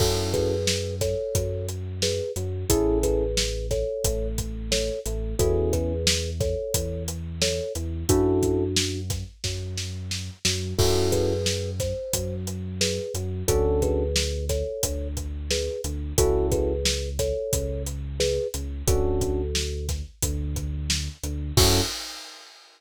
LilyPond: <<
  \new Staff \with { instrumentName = "Kalimba" } { \time 4/4 \key fis \minor \tempo 4 = 89 <fis' a'>8 <gis' b'>4 <a' cis''>4 r8 <gis' b'>8 r8 | <e' gis'>8 <gis' b'>4 <a' cis''>4 r8 <a' cis''>8 r8 | <fis' a'>8 <gis' b'>4 <a' cis''>4 r8 <a' cis''>8 r8 | <d' fis'>4. r2 r8 |
<fis' a'>8 <gis' b'>4 c''4 r8 <gis' b'>8 r8 | <fis' a'>8 <gis' b'>4 <a' cis''>4 r8 <gis' b'>8 r8 | <fis' a'>8 <gis' b'>4 <a' cis''>4 r8 <gis' b'>8 r8 | <fis' a'>4. r2 r8 |
fis'4 r2. | }
  \new Staff \with { instrumentName = "Electric Piano 1" } { \time 4/4 \key fis \minor <cis' e' fis' a'>4~ <cis' e' fis' a'>16 r8. fis4. fis8 | <cis' e' gis' a'>4~ <cis' e' gis' a'>16 r8. a4. a8 | <b cis' e' gis'>4~ <b cis' e' gis'>16 r8. e4. e8 | <cis' e' fis' a'>4~ <cis' e' fis' a'>16 r8. fis4. fis8 |
<cis' e' fis' a'>4~ <cis' e' fis' a'>16 r8. fis4. fis8 | <cis' d' fis' a'>4~ <cis' d' fis' a'>16 r8. d4. d8 | <cis' e' fis' a'>4~ <cis' e' fis' a'>16 r8. cis4. cis8 | <cis' d' fis' a'>4~ <cis' d' fis' a'>16 r8. d4. d8 |
<cis' e' fis' a'>4 r2. | }
  \new Staff \with { instrumentName = "Synth Bass 2" } { \clef bass \time 4/4 \key fis \minor fis,2 fis,4. fis,8 | a,,2 a,,4. a,,8 | e,2 e,4. e,8 | fis,2 fis,4. fis,8 |
fis,2 fis,4. fis,8 | d,2 d,4. d,8 | cis,2 cis,4. cis,8 | d,2 d,4. d,8 |
fis,4 r2. | }
  \new DrumStaff \with { instrumentName = "Drums" } \drummode { \time 4/4 <cymc bd>8 <hh bd>8 sn8 <hh bd sn>8 <hh bd>8 hh8 sn8 hh8 | <hh bd>8 <hh bd>8 sn8 <hh bd sn>8 <hh bd>8 <hh bd>8 sn8 hh8 | <hh bd>8 <hh bd>8 sn8 <hh bd sn>8 <hh bd>8 hh8 sn8 hh8 | <hh bd>8 <hh bd>8 sn8 <hh bd sn>8 <bd sn>8 sn8 sn8 sn8 |
<cymc bd>8 <hh bd>8 sn8 <hh bd sn>8 <hh bd>8 hh8 sn8 hh8 | <hh bd>8 <hh bd>8 sn8 <hh bd sn>8 <hh bd>8 <hh bd>8 sn8 hh8 | <hh bd>8 <hh bd>8 sn8 <hh bd sn>8 <hh bd>8 hh8 sn8 hh8 | <hh bd>8 <hh bd>8 sn8 <hh bd sn>8 <hh bd>8 <hh bd>8 sn8 hh8 |
<cymc bd>4 r4 r4 r4 | }
>>